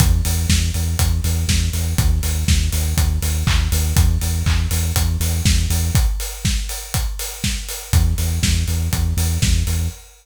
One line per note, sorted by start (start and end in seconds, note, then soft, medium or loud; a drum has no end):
0.00 0.21 E2 medium
0.00 kick loud
0.00 closed hi-hat loud
0.25 0.46 E2 medium
0.25 open hi-hat medium
0.49 0.70 E2 medium
0.49 kick medium
0.49 snare loud
0.74 0.96 E2 medium
0.74 open hi-hat medium
0.99 1.20 E2 medium
0.99 kick medium
0.99 closed hi-hat loud
1.24 1.45 E2 medium
1.24 open hi-hat medium
1.48 1.69 E2 medium
1.48 kick medium
1.48 snare medium
1.73 1.94 E2 medium
1.73 open hi-hat medium
1.98 2.20 D#2 medium
1.98 kick medium
1.98 closed hi-hat medium
2.23 2.44 D#2 medium
2.23 open hi-hat medium
2.48 2.69 D#2 medium
2.48 kick medium
2.48 snare medium
2.73 2.94 D#2 medium
2.73 open hi-hat medium
2.97 3.18 D#2 medium
2.97 kick medium
2.97 closed hi-hat medium
3.22 3.43 D#2 medium
3.22 open hi-hat medium
3.47 3.68 D#2 medium
3.47 kick medium
3.47 clap loud
3.72 3.93 D#2 medium
3.72 open hi-hat medium
3.96 4.18 E2 medium
3.96 kick medium
3.96 closed hi-hat medium
4.21 4.43 E2 medium
4.21 open hi-hat medium
4.46 4.67 E2 medium
4.46 kick medium
4.46 clap medium
4.71 4.92 E2 medium
4.71 open hi-hat medium
4.96 5.17 E2 medium
4.96 kick medium
4.96 closed hi-hat loud
5.20 5.41 E2 medium
5.20 open hi-hat medium
5.45 5.67 E2 medium
5.45 kick medium
5.45 snare loud
5.70 5.91 E2 medium
5.70 open hi-hat medium
5.95 kick loud
5.95 closed hi-hat medium
6.20 open hi-hat medium
6.45 kick medium
6.45 snare medium
6.69 open hi-hat medium
6.94 kick medium
6.94 closed hi-hat medium
7.19 open hi-hat medium
7.44 kick medium
7.44 snare medium
7.69 open hi-hat medium
7.93 8.14 E2 medium
7.93 kick medium
7.93 closed hi-hat medium
8.18 8.39 E2 medium
8.18 open hi-hat medium
8.43 8.64 E2 medium
8.43 kick medium
8.43 snare loud
8.68 8.89 E2 medium
8.68 open hi-hat medium
8.92 9.14 E2 medium
8.92 kick medium
8.92 closed hi-hat medium
9.17 9.38 E2 medium
9.17 open hi-hat medium
9.42 9.63 E2 medium
9.42 kick medium
9.42 snare medium
9.67 9.88 E2 medium
9.67 open hi-hat medium